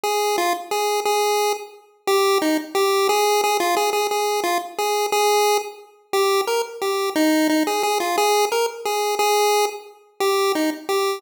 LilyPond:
\new Staff { \time 3/4 \key ees \major \tempo 4 = 177 aes'4 f'8 r8 aes'4 | aes'4. r4. | g'4 ees'8 r8 g'4 | aes'4 aes'8 f'8 aes'8 aes'8 |
aes'4 f'8 r8 aes'4 | aes'4. r4. | g'4 bes'8 r8 g'4 | ees'4 ees'8 aes'8 aes'8 f'8 |
aes'4 bes'8 r8 aes'4 | aes'4. r4. | g'4 ees'8 r8 g'4 | }